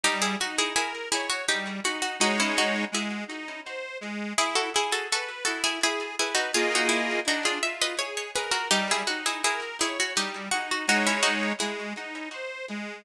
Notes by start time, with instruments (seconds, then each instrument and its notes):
0.03 accordion G3, harpsichord D#4 G4
0.22 harpsichord E4 G#4
0.41 accordion D#4, harpsichord F#4
0.58 harpsichord E4 G#4
0.76 harpsichord E4 G#4, accordion A#4
1.12 harpsichord E4 G#4, accordion C#5
1.30 harpsichord F#4
1.48 accordion G3, harpsichord D#4 G4
1.84 accordion D#4, harpsichord F#4
2.02 harpsichord F#4
2.20 accordion G#3 D#4 C#5, harpsichord D#4 F#4
2.40 harpsichord C#4 E4
2.58 harpsichord D#4 F#4
2.92 accordion G#3, harpsichord E4 G#4
3.28 accordion D#4
3.65 accordion C5
4.01 accordion G#3
4.38 accordion E4, harpsichord E4 G#4
4.55 harpsichord F#4 A4
4.75 harpsichord E4 G#4, accordion G#4
4.92 harpsichord F#4 A4
5.11 harpsichord F#4 A4, accordion B4
5.45 accordion E4, harpsichord F#4 A4
5.64 harpsichord E4 G#4
5.83 harpsichord E4 G#4, accordion G#4
6.19 harpsichord E4 G#4, accordion B4
6.35 harpsichord D#4 F#4
6.54 accordion A#3 F4 G#4 D#5, harpsichord F4 G#4
6.75 harpsichord D#4 F#4
6.89 harpsichord E4
7.26 accordion D4, harpsichord D#4 F#4
7.45 harpsichord F4 G#4
7.62 accordion F4, harpsichord E5
7.82 harpsichord B4 D#5
7.98 accordion G#4, harpsichord C#5
8.17 harpsichord C#5
8.36 harpsichord G#4 B4, accordion A#4
8.52 harpsichord F#4 A#4
8.70 accordion G3, harpsichord D#4 G4
8.91 harpsichord E4 G#4
9.07 accordion D#4, harpsichord F#4
9.26 harpsichord E4 G#4
9.44 harpsichord E4 G#4, accordion A#4
9.81 harpsichord E4 G#4, accordion C#5
10.00 harpsichord F#4
10.16 accordion G3, harpsichord D#4 G4
10.51 accordion D#4, harpsichord F#4
10.71 harpsichord F#4
10.88 accordion G#3 D#4 C#5, harpsichord D#4 F#4
11.07 harpsichord C#4 E4
11.23 harpsichord D#4 F#4
11.60 accordion G#3, harpsichord E4 G#4
11.96 accordion D#4
12.33 accordion C5
12.69 accordion G#3